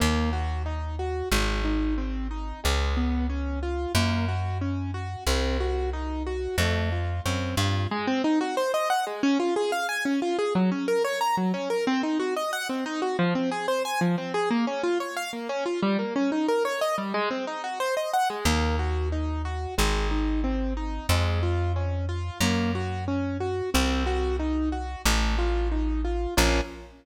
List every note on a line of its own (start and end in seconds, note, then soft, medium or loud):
0.00 1.23 D#2 medium
0.00 0.30 A#3 medium
0.33 0.62 F#4 medium
0.66 0.95 D#4 medium
0.99 1.29 F#4 medium
1.32 2.53 G#1 medium
1.32 1.62 G#3 medium
1.65 1.94 D#4 medium
1.98 2.27 C4 medium
2.31 2.60 D#4 medium
2.64 3.86 C#2 medium
2.64 2.93 G#3 medium
2.97 3.27 B3 medium
3.30 3.59 C#4 medium
3.63 3.92 F4 medium
3.95 5.16 F#2 medium
3.95 4.25 A#3 medium
4.28 4.58 F#4 medium
4.61 4.91 C#4 medium
4.94 5.24 F#4 medium
5.27 6.48 C2 medium
5.27 5.57 C4 medium
5.60 5.90 F#4 medium
5.93 6.23 D#4 medium
6.27 6.56 F#4 medium
6.58 7.20 F2 medium
6.58 6.89 A3 medium
6.92 7.22 F4 medium
7.25 7.55 F#2 medium
7.25 7.55 C4 medium
7.57 7.87 G2 medium
7.57 7.88 F4 medium
7.91 8.06 G#3 loud
8.07 8.22 C4 loud
8.24 8.39 D#4 medium
8.41 8.55 F#4 medium
8.57 8.72 C5 medium
8.74 8.89 D#5 medium
8.90 9.05 F#5 medium
9.07 9.22 G#3 medium
9.23 9.38 C#4 loud
9.40 9.54 F4 medium
9.56 9.71 G#4 medium
9.72 9.87 F5 medium
9.89 10.04 G#5 medium
10.05 10.20 C#4 medium
10.22 10.37 F4 medium
10.39 10.53 G#4 medium
10.55 10.70 F#3 loud
10.72 10.86 C#4 medium
10.88 11.03 A#4 medium
11.05 11.19 C#5 medium
11.21 11.36 A#5 medium
11.37 11.52 F#3 medium
11.54 11.69 C#4 medium
11.70 11.85 A#4 medium
11.87 12.02 C4 loud
12.03 12.18 D#4 medium
12.20 12.34 F#4 medium
12.37 12.51 D#5 medium
12.53 12.68 F#5 loud
12.69 12.84 C4 medium
12.86 13.01 D#4 loud
13.02 13.17 F#4 medium
13.19 13.34 F3 loud
13.35 13.50 C4 medium
13.52 13.66 G#4 medium
13.68 13.83 C5 medium
13.85 14.00 G#5 medium
14.01 14.16 F3 medium
14.18 14.33 C4 medium
14.34 14.49 G#4 medium
14.51 14.65 A#3 loud
14.67 14.82 C#4 medium
14.84 14.98 F4 medium
15.00 15.15 C#5 medium
15.16 15.31 F5 medium
15.33 15.48 A#3 medium
15.49 15.64 C#4 loud
15.66 15.80 F4 medium
15.83 15.97 G3 loud
15.99 16.14 A#3 medium
16.16 16.30 C#4 medium
16.32 16.47 D#4 medium
16.48 16.63 A#4 medium
16.65 16.80 C#5 medium
16.81 16.96 D#5 medium
16.98 17.13 G3 medium
17.14 17.29 G#3 loud
17.30 17.45 C4 medium
17.47 17.62 D#4 medium
17.64 17.79 F#4 medium
17.80 17.95 C5 medium
17.97 18.12 D#5 medium
18.13 18.28 F#5 medium
18.30 18.45 G#3 medium
18.45 19.67 D#2 medium
18.45 18.76 A#3 medium
18.79 19.09 F#4 medium
19.12 19.42 D#4 medium
19.45 19.75 F#4 medium
19.78 21.00 G#1 medium
19.78 20.08 G#3 medium
20.11 20.41 D#4 medium
20.44 20.74 C4 medium
20.77 21.07 D#4 medium
21.09 22.30 F2 medium
21.09 21.40 G#3 medium
21.43 21.72 F4 medium
21.76 22.06 C#4 medium
22.09 22.38 F4 medium
22.41 23.62 F#2 loud
22.41 22.71 A#3 medium
22.75 23.05 F#4 medium
23.08 23.38 C#4 medium
23.40 23.70 F#4 medium
23.74 24.96 C2 loud
23.74 24.04 C4 medium
24.06 24.36 F#4 medium
24.40 24.69 D#4 medium
24.72 25.02 F#4 medium
25.05 26.27 A1 loud
25.05 25.35 A3 medium
25.38 25.68 F4 medium
25.72 26.01 D#4 medium
26.05 26.34 F4 medium
26.37 26.61 A#1 loud
26.37 26.60 A#3 loud
26.37 26.60 C#4 loud
26.37 26.60 F4 loud